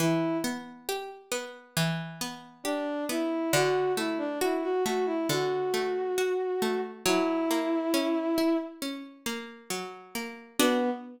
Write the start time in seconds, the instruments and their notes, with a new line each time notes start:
0.00 harpsichord E3, violin E4
0.44 harpsichord B3
0.89 harpsichord G4
1.32 harpsichord B3
1.77 harpsichord E3
2.21 harpsichord B3
2.64 violin D4, harpsichord G4
3.09 harpsichord B3, violin E4
3.53 harpsichord D3, violin F#4
3.97 harpsichord A3, violin E4
4.18 violin D4
4.41 violin E4, harpsichord F#4
4.63 violin F#4
4.84 harpsichord A3, violin F#4
5.06 violin E4
5.29 harpsichord D3, violin F#4
5.74 harpsichord A3
6.18 harpsichord F#4
6.62 harpsichord A3
7.05 harpsichord F#3, violin E4
7.51 harpsichord A#3
7.94 harpsichord C#4
8.38 harpsichord E4
8.82 harpsichord C#4
9.26 harpsichord A#3
9.70 harpsichord F#3
10.15 harpsichord A#3
10.59 violin B3, harpsichord B3 D4 F#4